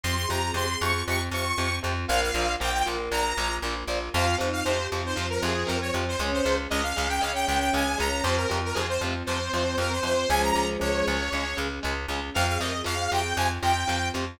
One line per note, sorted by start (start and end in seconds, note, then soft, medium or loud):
0.04 0.26 F2 loud
0.04 0.15 C3 medium
0.04 0.15 F3 medium
0.04 2.07 C4 medium
0.04 2.07 F4 medium
0.04 0.15 C6 medium
0.16 0.30 G#4 medium
0.16 0.28 C6 medium
0.29 0.52 F2 medium
0.29 0.39 C3 medium
0.29 0.39 F3 medium
0.29 0.41 G4 medium
0.29 0.51 A#5 medium
0.43 0.54 G#4 medium
0.54 0.76 F2 loud
0.54 0.66 C3 medium
0.54 0.66 F3 medium
0.54 0.67 G#4 medium
0.54 0.80 C6 medium
0.68 1.01 G#4 medium
0.81 1.03 F2 medium
0.81 0.92 C3 medium
0.81 0.92 F3 medium
0.81 1.02 C#6 medium
1.08 1.29 F2 loud
1.08 1.19 C3 medium
1.08 1.19 F3 medium
1.08 1.21 C#6 medium
1.31 1.53 F2 medium
1.31 1.44 C3 medium
1.31 1.44 F3 medium
1.31 1.76 C#6 medium
1.58 1.80 F2 medium
1.58 1.68 C3 medium
1.58 1.68 F3 medium
1.83 2.06 F2 loud
1.83 1.93 C3 medium
1.83 1.93 F3 medium
2.08 2.31 A#1 loud
2.08 2.19 A#2 medium
2.08 2.19 F3 medium
2.08 4.13 A#3 medium
2.08 4.13 F4 medium
2.08 2.30 A#4 loud
2.08 2.20 F5 medium
2.22 2.53 F5 medium
2.34 2.56 A#1 medium
2.34 2.46 A#2 medium
2.34 2.46 F3 medium
2.60 2.83 A#1 loud
2.60 2.70 A#2 medium
2.60 2.70 F3 medium
2.60 2.73 G5 medium
2.74 2.86 G5 medium
2.85 3.09 A#1 medium
2.85 2.96 A#2 medium
2.85 2.96 F3 medium
2.85 3.32 A#4 medium
3.11 3.33 A#1 medium
3.11 3.22 A#2 medium
3.11 3.22 F3 medium
3.11 3.54 A#5 medium
3.37 3.59 A#1 medium
3.37 3.48 A#2 medium
3.37 3.48 F3 medium
3.62 3.84 A#1 medium
3.62 3.74 A#2 medium
3.62 3.74 F3 medium
3.88 4.09 A#1 medium
3.88 3.98 A#2 medium
3.88 3.98 F3 medium
4.13 4.36 F2 loud
4.13 4.26 C3 medium
4.13 4.26 F3 medium
4.13 6.17 C4 medium
4.13 4.35 F4 medium
4.13 6.17 F4 medium
4.13 4.36 F5 medium
4.38 4.62 F2 medium
4.38 4.49 C3 medium
4.38 4.49 F3 medium
4.38 4.72 D#4 medium
4.53 4.65 F5 medium
4.65 4.88 F2 medium
4.65 4.78 C3 medium
4.65 4.78 F3 medium
4.65 4.87 C5 medium
4.77 5.00 G4 medium
4.92 5.14 F2 medium
4.92 5.02 C3 medium
4.92 5.02 F3 medium
5.04 5.16 D#4 medium
5.04 5.27 C5 medium
5.16 5.39 F2 medium
5.16 5.26 C3 medium
5.16 5.26 F3 medium
5.16 6.11 F3 medium
5.30 5.42 A#4 medium
5.43 5.64 F2 loud
5.43 5.53 C3 medium
5.43 5.53 F3 medium
5.43 5.67 G#4 medium
5.67 5.91 F2 medium
5.67 5.77 C3 medium
5.67 5.77 F3 medium
5.67 5.79 A#4 medium
5.82 5.94 C#5 medium
5.94 6.16 F2 medium
5.94 6.04 C3 medium
5.94 6.04 F3 medium
6.08 6.21 C5 medium
6.18 6.41 C#2 loud
6.18 6.31 C#3 medium
6.18 6.31 G#3 medium
6.18 8.21 C#4 medium
6.18 6.44 C#4 loud
6.18 8.21 G#4 medium
6.33 6.56 C5 medium
6.45 6.67 C#2 medium
6.45 6.55 C#3 medium
6.45 6.55 G#3 medium
6.70 6.93 C#2 medium
6.70 6.81 C#3 medium
6.70 6.81 G#3 medium
6.70 6.82 D#5 medium
6.83 7.08 F5 medium
6.96 7.20 C#2 medium
6.96 7.07 C#3 medium
6.96 7.07 G#3 medium
7.09 7.21 G5 medium
7.20 7.45 C#2 medium
7.20 7.32 C#3 medium
7.20 7.32 G#3 medium
7.20 7.90 C#4 medium
7.20 7.32 F5 medium
7.35 7.47 G5 medium
7.47 7.70 C#2 loud
7.47 7.58 C#3 medium
7.47 7.58 G#3 medium
7.47 7.59 G5 medium
7.60 7.72 G5 medium
7.73 7.96 C#2 medium
7.73 7.83 C#3 medium
7.73 7.83 G#3 medium
7.73 7.98 G#5 medium
7.98 8.22 C#2 medium
7.98 8.08 C#3 medium
7.98 8.08 G#3 medium
7.98 8.24 C#4 medium
7.98 8.23 A#5 medium
8.23 8.46 F2 loud
8.23 8.37 C3 medium
8.23 8.37 F3 medium
8.23 10.27 C4 medium
8.23 8.48 C4 medium
8.23 10.27 F4 medium
8.23 8.35 C5 medium
8.37 8.58 A#4 medium
8.49 8.73 F2 medium
8.49 8.60 C3 medium
8.49 8.60 F3 medium
8.65 8.77 A#4 medium
8.74 8.98 F2 medium
8.74 8.85 C3 medium
8.74 8.85 F3 medium
8.74 8.87 G#4 medium
8.89 9.01 C5 medium
9.01 9.23 F2 medium
9.01 9.14 C3 medium
9.01 9.14 F3 medium
9.26 9.49 F2 medium
9.26 9.39 C3 medium
9.26 9.39 F3 medium
9.26 9.96 C4 medium
9.26 9.76 C5 medium
9.54 9.75 F2 medium
9.54 9.64 C3 medium
9.54 9.64 F3 medium
9.78 10.00 F2 medium
9.78 9.89 C3 medium
9.78 9.89 F3 medium
9.78 9.92 A#4 medium
9.92 10.04 C5 medium
10.03 10.25 F2 medium
10.03 10.14 C3 medium
10.03 10.14 F3 medium
10.03 10.27 C4 medium
10.03 10.29 C5 medium
10.29 10.52 C#2 loud
10.29 10.39 C#3 medium
10.29 11.16 F3 medium
10.29 10.39 G#3 medium
10.29 11.16 G#3 medium
10.29 12.33 C#4 medium
10.29 12.33 G#4 medium
10.29 10.42 G#5 medium
10.43 10.67 A#5 medium
10.54 10.77 C#2 medium
10.54 10.64 C#3 medium
10.54 10.64 G#3 medium
10.79 11.03 C#2 medium
10.79 10.89 C#3 medium
10.79 10.89 G#3 medium
10.79 11.57 C#5 medium
11.07 11.29 C#2 medium
11.07 11.18 C#3 medium
11.07 11.18 G#3 medium
11.32 11.54 C#2 medium
11.32 11.44 C#3 medium
11.32 11.44 G#3 medium
11.57 11.80 C#2 medium
11.57 11.67 C#3 medium
11.57 11.67 G#3 medium
11.83 12.06 C#2 medium
11.83 11.93 C#3 medium
11.83 11.93 G#3 medium
12.08 12.30 C#2 medium
12.08 12.20 C#3 medium
12.08 12.20 G#3 medium
12.34 12.58 F2 loud
12.34 12.46 C3 medium
12.34 12.46 F3 medium
12.34 14.38 C4 medium
12.34 14.38 F4 medium
12.34 12.46 F5 medium
12.47 12.59 G#4 medium
12.47 12.60 F5 medium
12.60 12.82 F2 medium
12.60 12.71 C3 medium
12.60 12.71 F3 medium
12.60 12.73 A#4 medium
12.60 12.81 D#5 medium
12.73 12.85 G#4 medium
12.84 13.08 F2 medium
12.84 12.95 C3 medium
12.84 12.95 F3 medium
12.84 12.98 G#4 medium
12.84 13.10 F5 medium
12.99 13.34 G#4 medium
13.12 13.33 F2 medium
13.12 13.22 C3 medium
13.12 13.22 F3 medium
13.12 13.36 G5 medium
13.37 13.59 F2 loud
13.37 13.48 C3 medium
13.37 13.48 F3 medium
13.37 13.49 G#5 medium
13.63 13.84 F2 medium
13.63 13.73 C3 medium
13.63 13.73 F3 medium
13.63 14.08 G5 medium
13.88 14.11 F2 medium
13.88 13.98 C3 medium
13.88 13.98 F3 medium
14.14 14.37 F2 medium
14.14 14.24 C3 medium
14.14 14.24 F3 medium